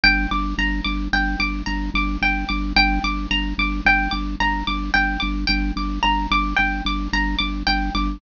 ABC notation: X:1
M:5/4
L:1/8
Q:1/4=110
K:Gm
V:1 name="Pizzicato Strings"
g d' b d' g d' b d' g d' | g d' b d' g d' b d' g d' | g d' b d' g d' b d' g d' |]
V:2 name="Drawbar Organ" clef=bass
G,,, G,,, G,,, G,,, G,,, G,,, G,,, G,,, G,,, G,,, | G,,, G,,, G,,, G,,, G,,, G,,, G,,, G,,, G,,, G,,, | G,,, G,,, G,,, G,,, G,,, G,,, G,,, G,,, G,,, G,,, |]